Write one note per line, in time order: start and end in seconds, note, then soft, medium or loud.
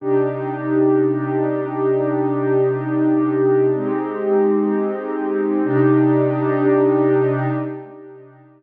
0.00 3.70 C3 medium
0.00 3.70 D4 medium
0.00 3.70 D#4 medium
0.00 3.70 G4 medium
3.74 5.60 G#3 medium
3.74 5.60 C4 medium
3.74 5.60 D#4 medium
3.74 5.60 G4 medium
5.64 7.46 C3 loud
5.64 7.46 D4 loud
5.64 7.46 D#4 loud
5.64 7.46 G4 medium